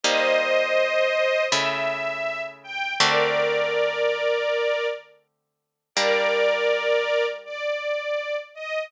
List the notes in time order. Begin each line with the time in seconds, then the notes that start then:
0.03 G3 A#3 D#4 C5 D#5
1.52 C#3 A3 E4 E5
2.63 G5
3.00 D3 A3 C4 F#4 A#4 D5
5.95 G3 A#3 D4 A#4 D5
7.45 D5
8.55 D#5